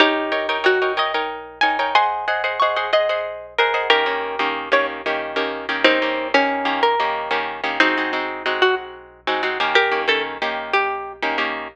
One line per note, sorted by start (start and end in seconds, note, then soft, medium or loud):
0.00 0.58 D#4 medium
0.00 0.58 G4 medium
0.00 0.30 A#4 loud
0.00 0.30 C#5 loud
0.00 0.30 G5 loud
0.32 0.47 D#4 medium
0.32 0.47 A#4 medium
0.32 0.47 C#5 medium
0.32 0.47 G5 loud
0.49 0.63 D#4 loud
0.49 0.63 A#4 loud
0.49 0.63 C#5 medium
0.49 0.63 G5 medium
0.64 0.79 D#4 medium
0.64 0.92 F#4 medium
0.64 0.79 A#4 loud
0.64 0.79 C#5 medium
0.64 0.79 G5 medium
0.82 0.97 D#4 medium
0.82 0.97 A#4 medium
0.82 0.97 C#5 medium
0.82 0.97 G5 medium
0.97 1.12 D#4 medium
0.97 1.12 A#4 medium
0.97 1.12 C#5 medium
0.97 1.59 D#5 medium
0.97 1.12 G5 medium
1.14 1.59 D#4 medium
1.14 1.59 A#4 loud
1.14 1.59 C#5 medium
1.14 1.59 G5 medium
1.61 1.78 D#4 medium
1.61 1.78 A#4 medium
1.61 1.78 C#5 medium
1.61 1.78 G5 medium
1.61 1.92 G#5 medium
1.79 1.94 D#4 medium
1.79 1.94 A#4 medium
1.79 1.94 C#5 medium
1.79 1.94 G5 medium
1.95 2.25 G#4 loud
1.95 2.25 C5 medium
1.95 2.25 D#5 loud
1.95 2.25 F#5 loud
1.95 2.48 G#5 medium
1.95 2.48 C6 medium
2.28 2.43 G#4 medium
2.28 2.43 C5 medium
2.28 2.43 D#5 medium
2.28 2.43 F#5 medium
2.44 2.59 G#4 medium
2.44 2.59 C5 medium
2.44 2.59 D#5 medium
2.44 2.59 F#5 medium
2.60 2.76 G#4 medium
2.60 2.76 C5 medium
2.60 2.76 D#5 loud
2.60 2.76 F#5 medium
2.60 2.87 C#6 medium
2.76 2.91 G#4 medium
2.76 2.91 C5 medium
2.76 2.91 D#5 medium
2.76 2.91 F#5 loud
2.93 3.08 G#4 medium
2.93 3.08 C5 medium
2.93 3.47 D#5 medium
2.93 3.08 F#5 medium
3.09 3.54 G#4 medium
3.09 3.54 C5 medium
3.09 3.54 D#5 medium
3.09 3.54 F#5 medium
3.58 3.73 G#4 medium
3.58 3.88 A#4 medium
3.58 3.73 C5 medium
3.58 3.73 D#5 medium
3.58 3.73 F#5 loud
3.74 3.89 G#4 medium
3.74 3.89 C5 medium
3.74 3.89 D#5 medium
3.74 3.89 F#5 medium
3.90 4.05 D#3 loud
3.90 4.05 A#3 loud
3.90 4.05 C#4 loud
3.90 4.57 G4 medium
3.90 4.57 A#4 loud
4.06 4.36 D#3 medium
4.06 4.36 A#3 medium
4.06 4.36 C#4 medium
4.06 4.36 G4 medium
4.39 4.69 D#3 medium
4.39 4.69 A#3 medium
4.39 4.69 C#4 medium
4.39 4.69 G4 medium
4.72 5.02 D#3 loud
4.72 5.02 A#3 medium
4.72 5.02 C#4 medium
4.72 5.02 G4 loud
4.72 4.87 C#5 medium
5.06 5.36 D#3 medium
5.06 5.36 A#3 medium
5.06 5.36 C#4 medium
5.06 5.36 G4 medium
5.36 5.66 D#3 medium
5.36 5.66 A#3 medium
5.36 5.66 C#4 medium
5.36 5.66 G4 medium
5.69 5.84 D#3 medium
5.69 5.84 A#3 medium
5.69 5.84 C#4 medium
5.69 5.84 G4 medium
5.84 5.99 D#3 loud
5.84 5.99 A#3 loud
5.84 6.28 C4 medium
5.84 5.99 C#4 loud
5.84 6.28 D#4 medium
5.84 5.99 G4 loud
6.02 6.32 D#3 medium
6.02 6.32 A#3 medium
6.02 6.32 C#4 medium
6.02 6.32 G4 medium
6.34 6.64 D#3 medium
6.34 6.64 A#3 medium
6.34 6.80 C#4 medium
6.34 6.64 G4 medium
6.65 6.95 D#3 medium
6.65 6.95 A#3 medium
6.65 6.95 C#4 medium
6.65 6.95 G4 medium
6.83 7.39 A#4 medium
7.00 7.29 D#3 medium
7.00 7.29 A#3 loud
7.00 7.29 C#4 medium
7.00 7.29 G4 medium
7.31 7.61 D#3 medium
7.31 7.61 A#3 medium
7.31 7.61 C#4 loud
7.31 7.61 G4 medium
7.64 7.79 D#3 medium
7.64 7.79 A#3 medium
7.64 7.79 C#4 medium
7.64 7.79 G4 medium
7.80 7.96 G#3 loud
7.80 8.47 C4 medium
7.80 8.47 D#4 loud
7.80 7.96 F#4 loud
7.97 8.12 G#3 loud
7.97 8.12 C4 medium
7.97 8.12 D#4 medium
7.97 8.12 F#4 medium
8.13 8.43 G#3 medium
8.13 8.43 C4 medium
8.13 8.43 D#4 medium
8.13 8.43 F#4 medium
8.46 9.20 G#3 loud
8.46 9.20 C4 medium
8.46 9.20 D#4 medium
8.46 9.20 F#4 medium
8.62 8.75 F#4 medium
9.27 9.42 G#3 loud
9.27 9.42 C4 loud
9.27 9.42 D#4 medium
9.27 9.42 F#4 medium
9.43 9.58 G#3 medium
9.43 9.58 C4 medium
9.43 9.58 D#4 medium
9.43 9.58 F#4 loud
9.60 9.91 D#3 loud
9.60 9.91 A#3 loud
9.60 9.91 C#4 loud
9.60 9.91 G4 loud
9.75 10.02 G4 medium
9.75 10.02 A#4 medium
9.92 10.06 D#3 medium
9.92 10.06 A#3 medium
9.92 10.06 C#4 medium
9.92 10.06 G4 medium
10.08 10.38 D#3 medium
10.08 10.38 A#3 medium
10.08 10.38 C#4 loud
10.08 10.38 G4 medium
10.08 10.23 A4 medium
10.42 11.17 D#3 medium
10.42 11.17 A#3 loud
10.42 11.17 C#4 medium
10.42 11.17 G4 medium
10.73 11.13 G4 medium
11.22 11.37 D#3 medium
11.22 11.37 A#3 medium
11.22 11.37 C#4 medium
11.22 11.37 G4 medium
11.38 11.68 D#3 medium
11.38 11.68 A#3 medium
11.38 11.68 C#4 medium
11.38 11.68 G4 medium